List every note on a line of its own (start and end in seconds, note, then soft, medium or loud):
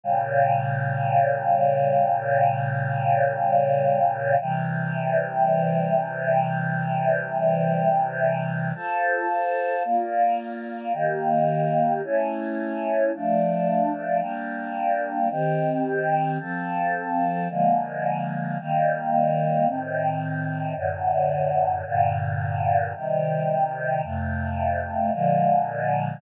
0.03 4.35 A#2 medium
0.03 4.35 C#3 medium
0.03 4.35 G3 medium
4.41 8.73 C3 medium
4.41 8.73 E3 medium
4.41 8.73 G3 medium
8.75 9.83 F4 medium
8.75 9.83 A4 medium
8.75 9.83 C5 medium
9.85 10.93 A#3 medium
9.85 10.93 F4 medium
9.85 10.93 D5 medium
10.93 12.01 D#3 medium
10.93 12.01 A#3 medium
10.93 12.01 G4 medium
12.03 13.11 A3 medium
12.03 13.11 C#4 medium
12.03 13.11 E4 medium
13.13 14.22 F3 medium
13.13 14.22 A3 medium
13.13 14.20 D4 medium
14.20 15.28 G3 medium
14.20 15.28 A#3 medium
14.20 15.28 D4 medium
15.30 16.38 D#3 medium
15.30 16.38 C4 medium
15.30 16.38 G4 medium
16.40 17.48 F3 medium
16.40 17.48 C4 medium
16.40 17.48 A4 medium
17.49 18.57 D3 medium
17.49 18.57 F3 medium
17.49 18.57 G#3 medium
17.49 18.57 A#3 medium
18.59 19.66 D#3 medium
18.59 19.67 G3 medium
18.59 19.67 A#3 medium
19.66 20.74 A2 medium
19.66 20.74 D#3 medium
19.66 20.74 C4 medium
20.76 21.84 F#2 medium
20.76 21.84 A2 medium
20.76 21.84 D3 medium
21.85 22.93 G2 medium
21.85 22.93 A#2 medium
21.85 22.93 D3 medium
22.94 24.02 C3 medium
22.94 24.02 D#3 medium
22.94 24.02 G3 medium
24.03 25.11 F2 medium
24.03 25.11 C3 medium
24.03 25.11 A3 medium
25.13 26.21 A#2 medium
25.13 26.21 D3 medium
25.13 26.21 F3 medium
25.13 26.21 G#3 medium